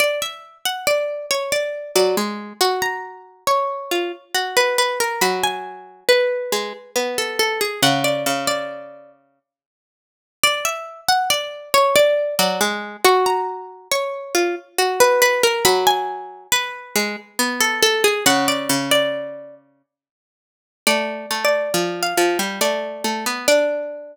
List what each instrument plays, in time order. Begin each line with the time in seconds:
0.00 pizzicato strings D5
0.22 pizzicato strings E5
0.65 pizzicato strings F#5
0.87 pizzicato strings D5
1.31 pizzicato strings C#5
1.52 pizzicato strings D5
1.95 harpsichord F#3, pizzicato strings D5
2.17 harpsichord G#3
2.61 harpsichord F#4, pizzicato strings C#6
2.82 pizzicato strings A#5
3.47 pizzicato strings C#5
3.91 harpsichord F4
4.35 harpsichord F#4
4.57 pizzicato strings B4
4.78 pizzicato strings B4
5.00 pizzicato strings A#4
5.21 harpsichord F#3, pizzicato strings B5
5.43 pizzicato strings G#5
6.09 pizzicato strings B4
6.52 harpsichord G#3
6.96 harpsichord B3
7.18 pizzicato strings A4
7.39 pizzicato strings A4
7.61 pizzicato strings G#4
7.82 harpsichord C#3, pizzicato strings F#5
8.04 pizzicato strings D5
8.26 harpsichord C#3
8.47 pizzicato strings D5
10.43 pizzicato strings D5
10.65 pizzicato strings E5
11.09 pizzicato strings F#5
11.30 pizzicato strings D5
11.74 pizzicato strings C#5
11.96 pizzicato strings D5
12.39 harpsichord F#3, pizzicato strings D5
12.61 harpsichord G#3
13.05 harpsichord F#4, pizzicato strings C#6
13.26 pizzicato strings A#5
13.91 pizzicato strings C#5
14.35 harpsichord F4
14.78 harpsichord F#4
15.00 pizzicato strings B4
15.22 pizzicato strings B4
15.43 pizzicato strings A#4
15.65 harpsichord F#3, pizzicato strings B5
15.87 pizzicato strings G#5
16.52 pizzicato strings B4
16.95 harpsichord G#3
17.39 harpsichord B3
17.61 pizzicato strings A4
17.82 pizzicato strings A4
18.04 pizzicato strings G#4
18.26 harpsichord C#3, pizzicato strings F#5
18.48 pizzicato strings D5
18.69 harpsichord C#3
18.91 pizzicato strings D5
20.87 harpsichord A3, pizzicato strings D5
21.31 harpsichord A3
21.45 pizzicato strings D5
21.74 harpsichord F3
22.03 pizzicato strings F5
22.17 harpsichord F3
22.39 harpsichord G3
22.61 harpsichord A3, pizzicato strings D5
23.04 harpsichord A3
23.26 harpsichord B3
23.48 harpsichord D4, pizzicato strings D5